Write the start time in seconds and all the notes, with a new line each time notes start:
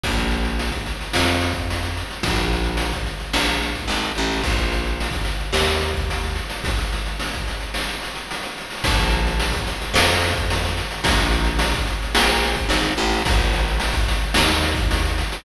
0.04 A#1, kick, closed hi-hat
0.17 snare, closed hi-hat
0.31 closed hi-hat
0.45 closed hi-hat
0.59 closed hi-hat
0.72 kick, closed hi-hat
0.86 closed hi-hat
1.01 closed hi-hat
1.13 F2, snare
1.27 closed hi-hat
1.41 snare, closed hi-hat
1.54 kick, closed hi-hat
1.70 closed hi-hat
1.83 closed hi-hat
1.97 closed hi-hat
2.11 closed hi-hat
2.23 A#1, kick, closed hi-hat
2.36 snare, closed hi-hat
2.53 closed hi-hat
2.64 closed hi-hat
2.77 closed hi-hat
2.93 kick, closed hi-hat
3.06 closed hi-hat
3.20 closed hi-hat
3.33 A#1, snare
3.47 closed hi-hat
3.62 closed hi-hat
3.75 kick, closed hi-hat
3.88 G#1, closed hi-hat
4.03 closed hi-hat
4.15 A1, closed hi-hat
4.31 open hi-hat
4.44 A#1, kick, closed hi-hat
4.58 snare, closed hi-hat
4.72 closed hi-hat
4.85 closed hi-hat
5.00 closed hi-hat
5.11 kick, closed hi-hat
5.25 closed hi-hat
5.40 closed hi-hat
5.53 D#2, snare
5.67 closed hi-hat
5.82 closed hi-hat
5.94 kick, closed hi-hat
6.10 closed hi-hat
6.23 closed hi-hat
6.35 closed hi-hat
6.50 closed hi-hat
6.64 kick, closed hi-hat
6.78 snare, closed hi-hat
6.93 closed hi-hat
7.06 closed hi-hat
7.20 closed hi-hat
7.33 kick, closed hi-hat
7.48 closed hi-hat
7.60 closed hi-hat
7.74 snare
7.89 closed hi-hat
8.03 closed hi-hat
8.15 closed hi-hat
8.31 closed hi-hat
8.43 closed hi-hat
8.58 closed hi-hat
8.70 open hi-hat
8.84 A#1, kick, closed hi-hat
8.99 snare, closed hi-hat
9.10 closed hi-hat
9.27 closed hi-hat
9.40 closed hi-hat
9.53 kick, closed hi-hat
9.67 closed hi-hat
9.82 closed hi-hat
9.94 F2, snare
10.09 closed hi-hat
10.21 snare, closed hi-hat
10.35 kick, closed hi-hat
10.50 closed hi-hat
10.65 closed hi-hat
10.77 closed hi-hat
10.91 closed hi-hat
11.04 A#1, kick, closed hi-hat
11.17 snare, closed hi-hat
11.31 closed hi-hat
11.45 closed hi-hat
11.59 closed hi-hat
11.74 kick, closed hi-hat
11.87 closed hi-hat
12.02 closed hi-hat
12.15 A#1, snare
12.28 closed hi-hat
12.43 closed hi-hat
12.54 kick, closed hi-hat
12.69 G#1, closed hi-hat
12.83 closed hi-hat
12.97 A1, closed hi-hat
13.10 open hi-hat
13.25 A#1, kick, closed hi-hat
13.39 snare, closed hi-hat
13.53 closed hi-hat
13.68 closed hi-hat
13.80 closed hi-hat
13.93 kick, closed hi-hat
14.08 closed hi-hat
14.21 closed hi-hat
14.34 D#2, snare
14.48 closed hi-hat
14.62 closed hi-hat
14.75 kick, closed hi-hat
14.91 closed hi-hat
15.05 closed hi-hat
15.18 closed hi-hat
15.32 closed hi-hat